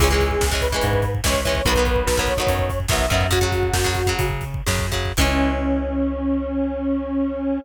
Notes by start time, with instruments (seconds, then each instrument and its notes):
0.00 electric bass (finger) C#2, acoustic guitar (steel) E3 G#3 C#4, lead 1 (square) G#4, kick, crash
0.10 acoustic guitar (steel) E3 G#3 C#4, kick
0.20 kick, closed hi-hat
0.31 kick
0.41 electric bass (finger) C#2, kick, snare
0.51 acoustic guitar (steel) E3 G#3 C#4, kick
0.61 lead 1 (square) B4, kick, closed hi-hat
0.72 acoustic guitar (steel) E3 G#3 C#4, kick
0.81 electric bass (finger) G#2, kick, closed hi-hat
0.93 kick
1.02 kick, closed hi-hat
1.15 kick
1.24 electric bass (finger) C#2, acoustic guitar (steel) E3 G#3 C#4, lead 1 (square) C#5, kick, snare
1.34 kick
1.45 acoustic guitar (steel) E3 G#3 C#4, kick, closed hi-hat
1.55 kick
1.65 electric bass (finger) B1, acoustic guitar (steel) D#3 F#3 B3, lead 1 (square) B4, kick, closed hi-hat
1.75 acoustic guitar (steel) D#3 F#3, kick
1.79 acoustic guitar (steel) B3
1.85 kick, closed hi-hat
1.96 kick
2.07 electric bass (finger) B1, kick, snare
2.17 acoustic guitar (steel) D#3 F#3 B3, kick
2.26 lead 1 (square) C#5, kick, closed hi-hat
2.37 acoustic guitar (steel) D#3 F#3, kick
2.41 acoustic guitar (steel) B3
2.47 electric bass (finger) F#2, kick, closed hi-hat
2.59 kick
2.70 kick, closed hi-hat
2.80 kick
2.88 electric bass (finger) B1, acoustic guitar (steel) D#3 F#3, lead 1 (square) E5, kick, snare
2.93 acoustic guitar (steel) B3
2.99 kick
3.10 electric bass (finger) F#2, acoustic guitar (steel) D#3 F#3 B3, kick, closed hi-hat
3.21 kick
3.30 acoustic guitar (steel) C#3 F#3, lead 1 (square) F#4, kick, closed hi-hat
3.41 acoustic guitar (steel) C#3 F#3, kick
3.52 kick, closed hi-hat
3.63 kick
3.73 electric bass (finger) F#2, kick, snare
3.84 acoustic guitar (steel) C#3 F#3, kick
3.94 kick, closed hi-hat
4.07 acoustic guitar (steel) C#3 F#3, kick
4.19 electric bass (finger) C#3, kick, closed hi-hat
4.30 kick
4.41 kick, closed hi-hat
4.54 kick
4.66 electric bass (finger) F#2, acoustic guitar (steel) C#3 F#3, kick, snare
4.79 kick
4.92 acoustic guitar (steel) C#3 F#3, kick, closed hi-hat
5.05 kick
5.17 electric bass (finger) C#2, acoustic guitar (steel) E3 G#3, lead 1 (square) C#4, kick, crash
5.21 acoustic guitar (steel) C#4